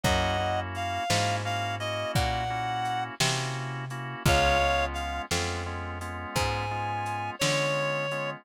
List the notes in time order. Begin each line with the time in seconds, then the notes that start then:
0.04 F#2 A#3 C#4 E4 F#4 D#5 F#5, kick, closed hi-hat
0.39 A#3 C#4 E4 F#4
0.75 F5, closed hi-hat
1.10 G#2 A#3 C#4 E4 F#4, snare
1.45 A#3 C#4 E4 F#4 F5
1.80 A#3 C#4 E4 F#4 D#5, closed hi-hat
2.15 A#2 F#5, kick, closed hi-hat
2.50 A#3 C#4 E4 F#4
2.85 closed hi-hat
3.20 C3 A#3 C#4 E4 F#4, snare
3.90 A#3 C#4 E4 F#4, closed hi-hat
4.25 C#2 G#3 B3 C#4 F4 C#5 F5, kick, closed hi-hat
4.61 G#3 B3 C#4 F4
4.93 F5, closed hi-hat
5.31 F2 G#3 B3 C#4 F4, snare
5.66 G#3 B3 C#4 F4
6.01 G#3 B3 C#4 F4, closed hi-hat
6.35 G#2 G#5, kick, closed hi-hat
6.71 G#3 B3 C#4 F4
7.06 closed hi-hat
7.39 D3 G#3 B3 C#4 F4 C#5, snare
8.11 G#3 B3 C#4 F4, closed hi-hat